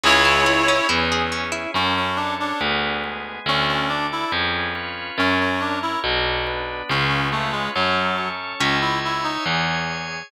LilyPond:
<<
  \new Staff \with { instrumentName = "Clarinet" } { \time 2/2 \key cis \minor \tempo 2 = 70 <e' cis''>2 r2 | \key fis \minor r1 | r1 | r1 |
r1 | \key cis \minor r1 | }
  \new Staff \with { instrumentName = "Clarinet" } { \time 2/2 \key cis \minor <gis gis'>4 r2. | \key fis \minor cis'8 cis'8 d'8 d'8 r2 | cis'8 cis'8 d'8 e'8 r2 | cis'8 cis'8 d'8 e'8 r2 |
cis'8 cis'8 a8 gis8 fis4. r8 | \key cis \minor cis'8 e'8 e'8 dis'8 r2 | }
  \new Staff \with { instrumentName = "Harpsichord" } { \time 2/2 \key cis \minor cis'8 e'8 gis'8 cis'8 e'8 gis'8 cis'8 e'8 | \key fis \minor r1 | r1 | r1 |
r1 | \key cis \minor <cis'' e'' gis''>1 | }
  \new Staff \with { instrumentName = "Harpsichord" } { \clef bass \time 2/2 \key cis \minor cis,2 e,2 | \key fis \minor fis,2 d,2 | d,2 eis,2 | fis,2 b,,2 |
cis,2 fis,2 | \key cis \minor cis,2 e,2 | }
  \new Staff \with { instrumentName = "Drawbar Organ" } { \time 2/2 \key cis \minor <cis' e' gis'>1 | \key fis \minor <cis' fis' a'>4 <cis' a' cis''>4 <b d' gis'>4 <gis b gis'>4 | <d' fis' a'>4 <d' a' d''>4 <cis' eis' gis' b'>4 <cis' eis' b' cis''>4 | <cis' fis' ais'>4 <cis' ais' cis''>4 <d' fis' b'>4 <b d' b'>4 |
<cis' eis' gis' b'>4 <cis' eis' b' cis''>4 <cis' fis' a'>4 <cis' a' cis''>4 | \key cis \minor <cis'' e'' gis''>2 <gis' cis'' gis''>2 | }
>>